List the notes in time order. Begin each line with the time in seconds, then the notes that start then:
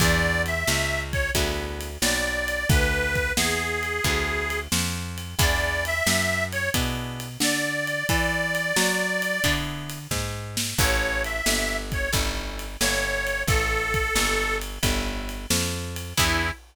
0.00 E2 B3 D4 E4 G#4 D5, kick, crash
0.46 E5, ride
0.67 C#2, snare
1.12 C#5, kick, ride
1.35 D2 B3 D4 E4 G#4, kick, ride
1.81 ride
2.02 B1 D5, snare
2.48 ride
2.69 D2 B4, kick, ride
3.15 kick, ride
3.37 E2 G#4, snare
3.83 ride
4.04 D2 B3 D4 E4 G#4, kick, ride
4.50 ride
4.72 F2, snare
5.18 ride
5.39 E2 B3 D4 E4 G#4 D5, kick, ride
5.85 E5, ride
6.06 F#2, snare
6.52 C#5, ride
6.74 B2 B3 D4 E4 G#4, kick, ride
7.20 ride
7.40 D3 D5, snare
7.87 ride
8.09 E3 D5, kick, ride
8.55 ride
8.76 F#3, snare
9.22 ride
9.44 D3 B3 D4 E4 G#4, kick, ride
9.90 ride
10.11 G#2, kick, snare
10.57 snare
10.78 A1 C#4 E4 G4 A4 C#5, kick, crash
11.24 E5, ride
11.46 G1, snare
11.92 C#5, kick, ride
12.12 G1 C#4 E4 G4 A4, kick, ride
12.59 ride
12.80 G1 C#5, snare
13.27 ride
13.47 A1 A4, kick, ride
13.94 kick, ride
14.15 G1, snare
14.62 ride
14.83 G1 C#4 E4 G4 A4, kick, ride
15.29 ride
15.50 F2, snare
15.96 ride
16.17 E2 B3 D4 E4 G#4, kick, crash